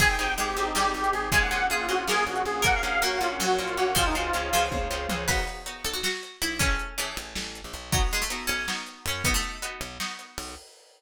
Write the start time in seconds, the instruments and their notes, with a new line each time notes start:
0.00 electric bass (finger) G#1, acoustic guitar (steel) C4 D#4 G4 G#4, pad 2 (warm) C4 D#4 G4 G#4, harpsichord G#4, lead 1 (square) G#5, kick, crash
0.10 lead 1 (square) G5
0.19 electric bass (finger) G#1, acoustic guitar (steel) C4 D#4 G4 G#4
0.38 electric bass (finger) G#1, harpsichord G#3, lead 1 (square) G4, closed hi-hat
0.57 electric bass (finger) G#1, acoustic guitar (steel) C4 D#4 G4 G#4, lead 1 (square) G4
0.66 lead 1 (square) D#4
0.75 electric bass (finger) G#1, harpsichord G3, acoustic guitar (steel) C4 D#4 G4 G#4, lead 1 (square) G4, snare
0.94 electric bass (finger) G#1, lead 1 (square) G4
1.04 closed hi-hat
1.13 electric bass (finger) G#1, lead 1 (square) G#4
1.31 electric bass (finger) A#1, harpsichord G#3, pad 2 (warm) A#3 C#4 F4 G#4, acoustic guitar (steel) A#3 C#4 F4 G#4, lead 1 (square) G#5, kick, closed hi-hat
1.42 lead 1 (square) F#5
1.51 electric bass (finger) A#1, acoustic guitar (steel) A#3 C#4 F4 G#4
1.70 electric bass (finger) A#1, lead 1 (square) F4, harpsichord G#4, closed hi-hat
1.89 electric bass (finger) A#1, acoustic guitar (steel) A#3 C#4 F4 G#4, lead 1 (square) F#4
1.98 lead 1 (square) F4
2.07 electric bass (finger) A#1, acoustic guitar (steel) A#3 C#4 F4 G#4, lead 1 (square) G#4, harpsichord A#4, snare
2.27 electric bass (finger) A#1, lead 1 (square) F#4
2.36 closed hi-hat
2.45 electric bass (finger) A#1, lead 1 (square) G#4
2.62 electric bass (finger) A#1, acoustic guitar (steel) A#3 C#4 F#4, harpsichord A#4, pad 2 (warm) A#4 C#5 F#5, lead 1 (square) F#5, kick, closed hi-hat
2.75 lead 1 (square) F5
2.83 electric bass (finger) A#1, acoustic guitar (steel) A#3 C#4 F#4
3.02 electric bass (finger) A#1, acoustic guitar (steel) A#3 C#4 F#4, harpsichord A#3, lead 1 (square) F#4, closed hi-hat
3.19 electric bass (finger) A#1, acoustic guitar (steel) A#3 C#4 F#4, lead 1 (square) F4
3.31 lead 1 (square) C#4
3.40 electric bass (finger) A#1, harpsichord F#3, lead 1 (square) F#4, snare
3.58 electric bass (finger) A#1, acoustic guitar (steel) A#3 C#4 F#4, lead 1 (square) F4
3.68 closed hi-hat
3.77 electric bass (finger) A#1, acoustic guitar (steel) A#3 C#4 F#4, lead 1 (square) F#4
3.95 electric bass (finger) C#2, harpsichord F3, acoustic guitar (steel) G#3 C4 C#4 F4, lead 1 (square) F4, pad 2 (warm) G#4 C5 C#5 F5, kick, closed hi-hat
4.06 lead 1 (square) D#4
4.15 electric bass (finger) C#2, acoustic guitar (steel) G#3 C4 C#4 F4, lead 1 (square) F4
4.33 electric bass (finger) C#2, acoustic guitar (steel) G#3 C4 C#4 F4, closed hi-hat
4.53 electric bass (finger) C#2, harpsichord F3, acoustic guitar (steel) G#3 C4 C#4 F4
4.71 electric bass (finger) C#2, kick, high tom
4.91 electric bass (finger) C#2, acoustic guitar (steel) G#3 C4 C#4 F4
5.09 electric bass (finger) C#2, acoustic guitar (steel) G#3 C4 C#4 F4, mid tom
5.28 electric bass (finger) B1, acoustic guitar (steel) B3 D#4 F#4, harpsichord B4, kick, crash
5.47 closed hi-hat
5.66 acoustic guitar (steel) B3 D#4 F#4, closed hi-hat
5.84 electric bass (finger) B1, harpsichord A4, closed hi-hat
5.93 harpsichord F#4
6.03 harpsichord F#4, snare
6.23 closed hi-hat
6.42 electric bass (finger) B1, harpsichord E4, closed hi-hat
6.59 electric bass (finger) A1, acoustic guitar (steel) A3 C#4 E4 G#4, harpsichord C#4, kick, closed hi-hat
6.79 closed hi-hat
6.98 harpsichord E3, acoustic guitar (steel) A3 C#4 E4 G#4, closed hi-hat
7.17 electric bass (finger) A1, closed hi-hat
7.35 electric bass (finger) A1, snare
7.55 closed hi-hat
7.64 electric bass (finger) A#1
7.73 electric bass (finger) B1, closed hi-hat
7.92 harpsichord F#3, acoustic guitar (steel) B3 D#4 F#4, kick, closed hi-hat
8.11 harpsichord G#3, closed hi-hat
8.22 harpsichord A3
8.30 acoustic guitar (steel) B3 D#4 F#4, closed hi-hat
8.47 electric bass (finger) B1, harpsichord C#4, closed hi-hat
8.68 acoustic guitar (steel) B3 D#4 F#4, snare
8.87 closed hi-hat
9.06 electric bass (finger) F#2, harpsichord C#4, closed hi-hat
9.24 electric bass (finger) B1, acoustic guitar (steel) B3 D#4 F#4, harpsichord B3, kick, closed hi-hat
9.34 harpsichord A3
9.43 closed hi-hat
9.62 acoustic guitar (steel) B3 D#4 F#4, closed hi-hat
9.81 electric bass (finger) B1, closed hi-hat
10.00 acoustic guitar (steel) B3 D#4 F#4, snare
10.19 closed hi-hat
10.38 electric bass (finger) B1, open hi-hat